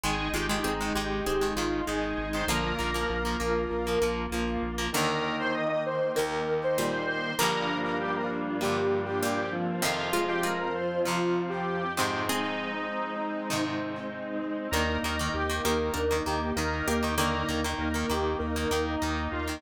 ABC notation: X:1
M:4/4
L:1/16
Q:1/4=98
K:Eb
V:1 name="Lead 1 (square)"
A2 G G E2 G4 F2 A3 c | B12 z4 | B3 c e e c2 B3 c3 c2 | B3 B G B z2 G3 G3 z2 |
F3 G B B c2 F3 G3 G2 | E10 z6 | B2 B B G2 B4 G2 B3 G | B3 z B B G2 B3 E3 F2 |]
V:2 name="Harpsichord"
z2 [A,F]2 [CA]4 [CA]8 | [D,B,]8 z8 | [D,B,]12 [B,,G,]4 | [D,B,]12 [B,,G,]4 |
[E,C]2 [A,F]2 [A,F]2 z10 | [CA]12 z4 | [DB]3 z3 [B,G]2 [DB]6 [B,G]2 | [D,B,]16 |]
V:3 name="Acoustic Guitar (steel)"
[E,A,]2 [E,A,] [E,A,]2 [E,A,] [E,A,]3 [E,A,] [E,A,]2 [E,A,]3 [E,A,] | [F,B,]2 [F,B,] [F,B,]2 [F,B,] [F,B,]3 [F,B,] [F,B,]2 [F,B,]3 [F,B,] | [E,,E,B,]8 [E,,E,B,]8 | [G,,D,F,B,]8 [G,,D,F,B,]8 |
[F,,C,F,]8 [F,,C,F,]6 [A,,C,E,]2- | [A,,C,E,]8 [A,,C,E,]8 | [E,B,]2 [E,B,] [E,B,]2 [E,B,] [E,B,]3 [E,B,] [E,B,]2 [E,B,]3 [E,B,] | [E,B,]2 [E,B,] [E,B,]2 [E,B,] [E,B,]3 [E,B,] [E,B,]2 [E,B,]3 [E,B,] |]
V:4 name="Drawbar Organ"
[A,E]4 [A,E]4 [A,E]4 [A,E]4 | [B,F]4 [B,F]4 [B,F]4 [B,F]4 | [E,B,E]16 | [G,B,DF]14 [F,CF]2- |
[F,CF]14 [A,CE]2- | [A,CE]16 | [B,E]4 [B,E]4 [B,E]4 [B,E]4 | [B,E]4 [B,E]4 [B,E]4 [B,E]4 |]
V:5 name="Synth Bass 1" clef=bass
A,,,2 A,,,2 A,,,2 A,,,2 A,,,2 A,,,2 A,,,2 A,,,2 | B,,,2 B,,,2 B,,,2 B,,,2 B,,,2 B,,,2 B,,,2 B,,,2 | z16 | z16 |
z16 | z16 | E,,2 E,,2 E,,2 E,,2 E,,2 E,,2 E,,2 E,,2- | E,,2 E,,2 E,,2 E,,2 E,,2 E,,2 E,,2 E,,2 |]
V:6 name="String Ensemble 1"
[A,E]16 | [B,F]16 | [E,B,E]16 | [G,,F,B,D]16 |
[F,,F,C]16 | [A,CE]16 | [B,E]16 | [B,E]16 |]